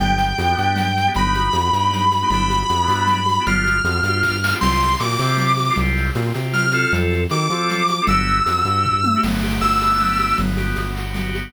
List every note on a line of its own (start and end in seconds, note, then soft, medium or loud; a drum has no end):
0.00 0.33 G1 medium
0.00 0.31 B3 loud
0.00 0.31 D4 loud
0.00 0.31 G4 medium
0.00 1.10 G5 medium
0.00 low conga loud
0.00 shaker medium
0.18 shaker medium
0.38 0.55 F2 medium
0.38 0.48 B3 medium
0.38 0.48 D4 medium
0.38 0.48 G4 medium
0.38 high conga medium
0.38 shaker medium
0.50 0.56 B3 medium
0.50 0.57 D4 medium
0.50 0.57 G4 medium
0.57 1.09 G2 medium
0.57 0.89 B3 medium
0.57 0.89 D4 medium
0.57 0.89 G4 medium
0.57 shaker medium
0.76 low conga medium
0.76 shaker medium
0.97 shaker medium
1.07 1.13 B3 medium
1.07 1.13 D4 loud
1.07 1.13 G4 medium
1.14 1.49 G1 medium
1.14 1.49 B3 loud
1.14 1.49 D#4 medium
1.14 2.29 B5 medium
1.14 low conga medium
1.14 shaker medium
1.19 1.49 G4 medium
1.34 high conga medium
1.34 shaker medium
1.53 1.71 F2 medium
1.53 1.62 B3 medium
1.53 1.62 D#4 medium
1.53 1.62 G4 medium
1.53 high conga medium
1.53 shaker medium
1.65 1.71 B3 medium
1.65 1.71 D#4 medium
1.65 1.71 G4 medium
1.73 2.24 G2 medium
1.73 2.05 B3 medium
1.73 2.05 D#4 medium
1.73 2.05 G4 medium
1.73 shaker medium
1.91 low conga medium
1.91 shaker medium
2.11 high conga medium
2.11 shaker medium
2.22 2.29 B3 medium
2.22 2.29 D#4 medium
2.22 2.29 G4 medium
2.30 2.64 G1 medium
2.30 2.63 B3 loud
2.30 2.63 D4 loud
2.30 2.63 E4 loud
2.30 2.63 G4 loud
2.30 3.43 B5 medium
2.30 low conga loud
2.30 shaker medium
2.50 high conga medium
2.50 shaker medium
2.69 2.87 F2 medium
2.69 2.78 B3 medium
2.69 2.78 D4 medium
2.69 2.78 E4 medium
2.69 2.78 G4 medium
2.69 high conga medium
2.69 shaker medium
2.81 2.87 B3 medium
2.81 2.88 D4 medium
2.81 2.88 E4 medium
2.81 2.88 G4 medium
2.88 3.39 G2 medium
2.88 3.20 B3 loud
2.88 3.20 D4 loud
2.88 3.20 E4 medium
2.88 3.20 G4 medium
2.88 high conga medium
2.88 shaker medium
3.07 low conga medium
3.07 shaker medium
3.26 high conga medium
3.26 shaker medium
3.39 3.45 B3 medium
3.39 3.45 D4 medium
3.39 3.45 E4 medium
3.39 3.45 G4 medium
3.46 3.80 G1 medium
3.46 3.78 B3 loud
3.46 3.78 D4 loud
3.46 3.78 F4 loud
3.46 3.78 G4 loud
3.46 4.52 F6 medium
3.46 low conga loud
3.46 shaker medium
3.65 high conga medium
3.65 shaker medium
3.84 4.01 F2 medium
3.84 3.94 B3 medium
3.84 3.94 D4 medium
3.84 3.94 F4 medium
3.84 3.94 G4 medium
3.84 high conga medium
3.84 shaker medium
3.95 4.01 B3 medium
3.95 4.01 D4 medium
3.95 4.01 F4 medium
3.95 4.01 G4 medium
4.03 4.54 G2 medium
4.03 4.36 B3 medium
4.03 4.36 D4 medium
4.03 4.36 F4 medium
4.03 4.36 G4 medium
4.03 high conga medium
4.03 shaker medium
4.23 kick medium
4.23 snare medium
4.44 snare loud
4.52 4.59 B3 medium
4.52 4.59 D4 medium
4.52 4.59 F4 medium
4.52 4.59 G4 medium
4.61 4.96 C2 medium
4.61 4.93 C4 loud
4.61 4.93 F4 medium
4.61 4.93 G4 medium
4.61 4.99 C6 medium
4.61 crash loud
4.61 low conga loud
4.61 shaker medium
4.81 shaker medium
4.99 5.17 A#2 medium
4.99 5.09 C4 medium
4.99 5.09 F4 medium
4.99 5.09 G4 medium
4.99 5.74 D6 medium
4.99 high conga medium
4.99 shaker medium
5.10 5.16 C4 medium
5.10 5.16 F4 medium
5.10 5.16 G4 medium
5.19 5.70 C3 medium
5.19 5.53 C4 medium
5.19 5.53 F4 medium
5.19 5.53 G4 medium
5.19 shaker medium
5.37 low conga medium
5.37 shaker medium
5.57 high conga medium
5.57 shaker medium
5.70 5.76 C4 medium
5.70 5.76 F4 loud
5.70 5.76 G4 medium
5.76 6.11 C2 medium
5.76 6.11 C4 medium
5.76 6.11 F4 medium
5.76 low conga loud
5.76 shaker medium
5.80 6.11 G4 loud
5.97 shaker medium
6.15 6.32 A#2 medium
6.15 6.25 C4 medium
6.15 6.25 F4 medium
6.15 6.25 G4 medium
6.15 high conga medium
6.15 shaker medium
6.26 6.33 C4 medium
6.26 6.33 F4 medium
6.26 6.33 G4 medium
6.34 6.86 C3 medium
6.34 6.66 C4 medium
6.34 6.66 F4 medium
6.34 6.66 G4 medium
6.34 high conga medium
6.34 shaker medium
6.53 6.92 F6 medium
6.53 low conga medium
6.53 shaker medium
6.71 7.24 C4 loud
6.71 7.24 F4 medium
6.71 7.24 A4 loud
6.71 high conga medium
6.71 shaker medium
6.93 7.26 F2 loud
6.93 low conga medium
6.93 shaker medium
7.11 high conga medium
7.11 shaker medium
7.29 7.48 D#3 medium
7.29 7.40 C4 medium
7.29 7.40 F4 medium
7.29 7.40 A4 medium
7.29 8.03 D6 medium
7.29 high conga medium
7.29 shaker medium
7.41 7.48 C4 medium
7.41 7.48 F4 medium
7.41 7.48 A4 medium
7.50 8.00 F3 medium
7.50 7.83 C4 medium
7.50 7.83 F4 medium
7.50 7.83 A4 medium
7.50 high conga medium
7.50 shaker medium
7.70 low conga medium
7.70 shaker medium
7.88 high conga medium
7.88 shaker medium
8.01 8.08 C4 medium
8.01 8.08 F4 medium
8.01 8.08 A4 medium
8.07 8.41 G1 medium
8.07 8.40 B3 loud
8.07 8.40 D4 medium
8.07 8.40 F#4 loud
8.07 8.40 G4 loud
8.07 9.20 E6 medium
8.07 low conga loud
8.07 shaker medium
8.28 shaker medium
8.45 8.63 F2 medium
8.45 8.54 B3 medium
8.45 8.54 D4 medium
8.45 8.54 F#4 medium
8.45 8.54 G4 medium
8.45 high conga medium
8.45 shaker medium
8.57 8.64 B3 medium
8.57 8.64 D4 medium
8.57 8.64 F#4 medium
8.57 8.64 G4 medium
8.65 9.15 G2 medium
8.65 8.97 B3 medium
8.65 8.97 D4 medium
8.65 8.97 F#4 medium
8.65 8.97 G4 medium
8.65 high conga medium
8.65 shaker medium
8.85 kick medium
8.85 floor tom medium
9.04 high tom loud
9.15 9.21 B3 medium
9.15 9.21 D4 medium
9.15 9.21 F#4 medium
9.15 9.21 G4 medium
9.23 9.59 G1 medium
9.23 9.62 B3 loud
9.23 crash loud
9.23 low conga medium
9.23 shaker medium
9.43 10.19 G4 loud
9.43 shaker medium
9.61 10.33 G1 medium
9.61 10.00 B3 medium
9.61 10.35 E6 medium
9.61 high conga medium
9.61 shaker medium
9.81 10.37 D4 medium
9.81 high conga medium
9.81 shaker medium
9.99 10.37 B3 loud
9.99 low conga medium
9.99 shaker medium
10.19 10.38 G4 medium
10.19 high conga medium
10.19 shaker medium
10.38 10.74 G1 medium
10.38 10.78 B3 loud
10.38 low conga loud
10.38 shaker medium
10.57 11.34 G4 medium
10.57 high conga medium
10.57 shaker medium
10.76 11.49 G1 medium
10.76 11.15 B3 medium
10.76 high conga medium
10.76 shaker medium
10.94 11.50 F#4 medium
10.94 shaker medium
11.14 11.53 B3 loud
11.14 low conga medium
11.14 shaker medium
11.35 11.53 G4 medium
11.35 shaker medium